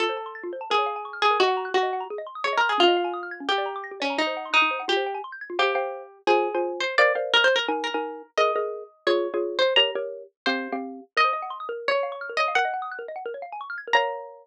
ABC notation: X:1
M:4/4
L:1/16
Q:1/4=172
K:Bbm
V:1 name="Harpsichord"
=A8 _A6 A2 | G4 G4 z4 (3d2 B2 A2 | F8 =G6 D2 | E4 E4 =G4 z4 |
[K:Fm] G8 A6 c2 | =d2 z2 (3B2 c2 B2 z2 B6 | e8 d6 c2 | b2 z6 c4 z4 |
[K:Bbm] e8 d6 e2 | g6 z10 | b16 |]
V:2 name="Xylophone"
F c =a c' =a' F c a B d f _a d' f' _a' B | e g b g' b' e g b A e c' e' A e c' e' | D e f a e' f' a' D =G =d b =d' b' G d b | E c g c' g' E c g F c =g a c' =g' a' F |
[K:Fm] [cfg]2 [cfg]6 [Fca]3 [Fca]5 | [Bc=df]2 [Bcdf]6 [EBa]3 [EBa]5 | [ABe]2 [ABe]6 [FAd]3 [FAd]5 | [GBd]2 [GBd]6 [CGf]3 [CGf]5 |
[K:Bbm] B c e g c' e' B3 d f d' f' B d f | B e g e' g' B e g B d f a d' f' a' B | [Bdf]16 |]